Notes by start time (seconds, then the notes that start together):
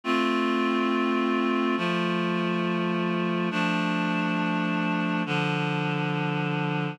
0.04 A3 C4 F4
1.77 F3 A3 F4
3.51 F3 A3 D4
5.26 D3 F3 D4